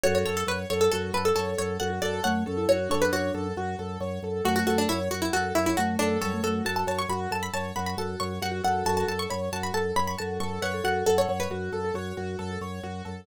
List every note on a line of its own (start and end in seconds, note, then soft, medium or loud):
0.04 0.24 F#2 loud
0.04 0.24 F#4 medium
0.04 0.43 A4 medium
0.04 0.14 C#5 medium
0.15 0.25 C#5 medium
0.25 0.44 F#2 medium
0.25 0.46 A4 medium
0.25 0.36 C#5 medium
0.37 0.47 A4 medium
0.46 0.65 F#2 medium
0.46 0.59 B4 medium
0.46 0.67 C#5 medium
0.70 0.89 F#2 loud
0.70 0.90 A4 medium
0.70 0.81 C#5 medium
0.81 0.91 A4 medium
0.92 1.12 F#2 loud
0.92 1.13 F#4 medium
0.92 1.11 A4 medium
1.13 1.32 F#2 medium
1.13 1.34 A4 medium
1.13 1.25 B4 medium
1.25 1.35 A4 medium
1.35 1.55 F#2 medium
1.35 1.75 A4 medium
1.35 1.54 A4 medium
1.35 1.56 C#5 medium
1.58 1.78 F#2 loud
1.58 1.78 A4 medium
1.58 1.78 C#5 medium
1.80 1.99 F#2 loud
1.80 2.01 F#4 medium
1.80 1.90 A4 medium
1.80 1.99 F#5 medium
1.90 2.00 F#4 medium
2.02 2.20 F#2 medium
2.02 2.20 F#4 medium
2.02 2.22 A4 medium
2.02 2.22 D5 medium
2.24 2.44 F#2 medium
2.24 2.43 A3 medium
2.24 2.43 C#5 medium
2.24 2.44 F#5 medium
2.46 2.66 F#2 loud
2.46 2.57 C#4 medium
2.46 2.66 A4 medium
2.57 2.76 E4 medium
2.69 2.88 F#2 medium
2.69 2.89 F#4 medium
2.69 2.89 C#5 medium
2.89 3.10 F#2 medium
2.89 3.47 D4 medium
2.89 3.11 A4 medium
2.89 3.01 C#5 medium
3.02 3.12 B4 medium
3.12 3.31 F#2 medium
3.12 3.70 F#4 medium
3.12 3.32 C#5 medium
3.34 3.53 F#2 loud
3.34 3.54 A4 medium
3.57 3.75 F#2 medium
3.57 3.77 F#4 medium
3.79 3.98 F#2 medium
3.79 3.99 A4 medium
4.00 4.19 F#2 loud
4.00 4.20 C#5 medium
4.23 4.41 F#2 medium
4.23 4.44 A4 medium
4.45 4.64 F#2 loud
4.45 4.87 A3 medium
4.45 4.65 F#4 medium
4.45 4.55 F#4 medium
4.56 4.66 F#4 medium
4.67 4.86 F#2 medium
4.67 4.77 F#4 medium
4.67 4.87 A4 medium
4.78 4.89 D4 medium
4.89 5.09 F#2 loud
4.89 4.99 E4 medium
4.89 5.09 C#5 medium
5.11 5.30 F#2 medium
5.11 5.22 F#4 medium
5.11 5.31 F#4 medium
5.22 5.32 E4 medium
5.33 5.52 F#2 medium
5.33 5.54 F#4 medium
5.33 5.53 A4 medium
5.55 5.74 F#2 medium
5.55 5.66 E4 medium
5.55 5.75 C#5 medium
5.66 5.77 E4 medium
5.77 5.96 F#2 medium
5.77 6.17 A3 medium
5.77 5.95 F#4 medium
5.77 5.97 F#4 medium
5.99 6.18 F#2 medium
5.99 6.19 D4 medium
5.99 6.19 A4 medium
6.21 6.41 F#2 loud
6.21 6.32 G3 medium
6.21 6.41 A4 medium
6.21 6.41 C#5 medium
6.34 6.43 A3 medium
6.43 6.61 F#2 medium
6.43 6.63 A3 medium
6.43 6.63 F#4 medium
6.43 6.63 A4 medium
6.65 6.84 F#2 medium
6.65 7.01 F#4 medium
6.65 6.85 A4 medium
6.65 6.76 A5 medium
6.76 6.87 A5 medium
6.87 7.06 F#2 medium
6.87 7.07 C#5 medium
6.87 6.99 A5 medium
6.99 7.09 C#6 medium
7.09 7.27 F#2 medium
7.09 7.30 F#4 medium
7.09 7.20 B5 medium
7.31 7.50 F#2 medium
7.31 7.51 A4 medium
7.31 7.43 A5 medium
7.43 7.53 B5 medium
7.53 7.72 F#2 medium
7.53 7.74 C#5 medium
7.53 7.72 A5 medium
7.76 7.95 F#2 loud
7.76 7.96 F#4 medium
7.76 7.86 B5 medium
7.86 7.97 B5 medium
7.97 8.16 F#2 medium
7.97 8.34 F#4 medium
7.97 8.18 A4 medium
7.97 8.19 A5 medium
8.20 8.39 F#2 loud
8.20 8.40 C#5 medium
8.20 8.39 C#6 medium
8.42 8.61 F#2 loud
8.42 8.62 F#4 medium
8.42 8.53 G4 medium
8.42 8.61 F#5 medium
8.52 8.62 F#4 medium
8.64 8.83 F#2 medium
8.64 8.85 F#4 medium
8.64 8.83 A4 medium
8.64 8.84 F#5 medium
8.85 9.04 F#2 loud
8.85 9.06 F#4 medium
8.85 9.26 A4 medium
8.85 8.97 A5 medium
8.97 9.08 A5 medium
9.08 9.27 F#2 medium
9.08 9.29 A4 medium
9.08 9.19 A5 medium
9.19 9.30 C#6 medium
9.30 9.49 F#2 medium
9.30 9.50 C#5 medium
9.30 9.41 B5 medium
9.52 9.71 F#2 medium
9.52 9.73 F#4 medium
9.52 9.63 A5 medium
9.63 9.74 B5 medium
9.74 9.93 F#2 medium
9.74 9.94 A4 medium
9.74 9.93 A5 medium
9.96 10.15 F#2 medium
9.96 10.16 C#5 medium
9.96 10.07 B5 medium
10.07 10.18 B5 medium
10.18 10.39 F#2 medium
10.18 10.37 F#4 medium
10.18 10.62 A4 medium
10.18 10.37 A5 medium
10.40 10.59 F#2 medium
10.40 10.60 A4 medium
10.40 10.58 C#6 medium
10.62 10.81 F#2 medium
10.62 10.72 B4 medium
10.62 10.83 C#5 medium
10.62 10.81 F#5 medium
10.74 10.84 A4 medium
10.84 11.03 F#2 medium
10.84 11.04 F#4 medium
10.84 11.04 A4 medium
10.84 11.06 F#5 medium
11.06 11.26 F#2 medium
11.06 11.26 A4 medium
11.06 11.17 A4 medium
11.06 11.38 F#5 medium
11.18 11.29 C#5 medium
11.28 11.47 F#2 medium
11.28 11.49 C#5 medium
11.40 12.68 B4 medium
11.50 11.69 F#2 medium
11.50 11.71 F#4 medium
11.50 11.79 F#4 medium
11.72 11.91 F#2 medium
11.72 11.93 A4 medium
11.85 11.95 A4 medium
11.94 12.13 F#2 medium
11.94 12.51 F#4 medium
11.94 12.15 C#5 medium
12.17 12.36 F#2 medium
12.17 12.37 F#4 medium
12.39 12.58 F#2 loud
12.39 12.59 A4 medium
12.61 12.80 F#2 medium
12.61 12.82 C#5 medium
12.83 13.02 F#2 medium
12.83 13.03 F#4 medium
13.05 13.25 F#2 medium
13.05 13.25 A4 medium